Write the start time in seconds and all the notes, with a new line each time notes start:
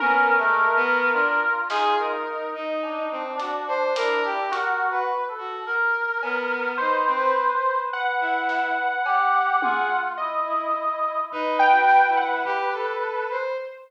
0.00 B3 C#4 A#4, high tom
0.38 G#3 A3
0.75 A3 B3
1.13 D4 F4
1.70 D#4 G#4, snare
1.98 A#4
2.54 D#4
2.83 D4, cowbell
3.11 C4
3.37 D4 F#4, closed hi-hat
3.68 C5
3.96 E4 A#4, closed hi-hat
4.25 G4
4.52 F#4 A#4, closed hi-hat
4.91 B4
5.28 A4
5.38 F#4
5.66 A#4
6.22 B3, cowbell
6.78 D#4 B4 C5
7.07 C4
7.17 B4
7.55 B4
7.93 B4 F#5
8.21 E4
8.49 snare
9.05 G4, cowbell
9.62 F4 G#4, high tom
10.17 E4 D#5
10.47 E4
11.32 D#4 B4, floor tom
11.59 G5
11.70 F#4
11.89 snare
12.08 E4
12.17 F#5
12.45 G4, floor tom
12.73 A4
13.30 C5